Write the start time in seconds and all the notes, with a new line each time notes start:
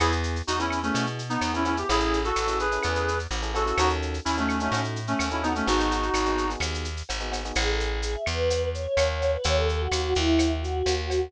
0.00 E2 B3 E4 G#4, cowbell, claves, shaker
0.12 shaker
0.23 shaker
0.36 shaker
0.47 E2 D#4 F#4, shaker
0.59 B3 C#4 E4 G#4, shaker
0.70 claves, shaker
0.82 A3 B3 C#4 E4 G#4, shaker
0.94 B2, cowbell, shaker
1.06 shaker
1.19 shaker
1.29 B3 D#4, shaker
1.41 E2, cowbell, claves, shaker
1.54 B3 C#4 E4 G#4, shaker
1.65 B3 C#4 E4 G#4, cowbell, shaker
1.77 B3 E4 G4 G#4, shaker
1.89 A1 C#4 E4 G#4 A4, cowbell, shaker
2.00 shaker
2.13 shaker
2.24 F#4 A4, shaker
2.36 A1, claves, shaker
2.47 C#4 E4 G#4 A4, shaker
2.59 G#4 B4, shaker
2.71 C#4 E4 G#4 A4, shaker
2.83 E2, cowbell, claves, shaker
2.95 shaker
3.08 shaker
3.19 shaker
3.31 A1, cowbell, shaker
3.42 C#4 E4 G#4 A4, shaker
3.54 C#4 E4 F#4 G#4 A4, cowbell, shaker
3.66 C#4 E4 G#4 A4, shaker
3.78 D#2 C#4 D#4 F#4 A4, cowbell, claves, shaker
3.89 shaker
4.02 shaker
4.14 shaker
4.25 D#2 C#4 E4, shaker
4.37 A3 C#4 D#4 F#4 A4, shaker
4.49 claves, shaker
4.60 A3 C#4 D#4 F#4 A4, shaker
4.72 A2, cowbell, shaker
4.84 shaker
4.96 shaker
5.07 A3 C#4, shaker
5.19 D#2, cowbell, claves, shaker
5.31 C#4 D#4 E4 F#4 A4, shaker
5.42 B3 C#4 D#4 F#4 A4, cowbell, shaker
5.55 A3 C#4 D#4 F#4 A4, shaker
5.66 G#1 B3 D#4 F#4 G#4, cowbell, shaker
5.80 shaker
5.91 shaker
6.03 shaker
6.14 G#1, claves, shaker
6.25 B3 D#4 F#4 G#4, shaker
6.38 shaker
6.49 B3 D#4 F#4 G#4, shaker
6.60 D#2, cowbell, claves, shaker
6.74 shaker
6.85 shaker
6.97 shaker
7.09 G#1, cowbell, shaker
7.20 B3 D#4 F#4 G#4, shaker
7.31 B3 D#4 F#4 G#4, cowbell, shaker
7.44 B3 D#4 F#4 G#4, shaker
7.55 A1 G#4, cowbell, claves, shaker
7.68 A4
7.80 G#4, shaker
7.90 G#4
8.02 G#4, shaker
8.14 E5
8.26 E2 B4, claves, shaker
8.50 cowbell, shaker
8.73 C#5, shaker
8.97 D#2, cowbell, claves, shaker
9.09 C#5
9.22 cowbell, shaker
9.34 B4
9.44 D#2 C#5, cowbell, shaker
9.57 A4
9.68 A4, shaker
9.80 F#4
9.91 D#2 F#4, claves, shaker
10.03 F#4
10.15 D#2 E4, shaker
10.39 cowbell, claves, shaker
10.62 F#4, shaker
10.86 D#2, cowbell, shaker
10.99 F#4
11.10 cowbell, shaker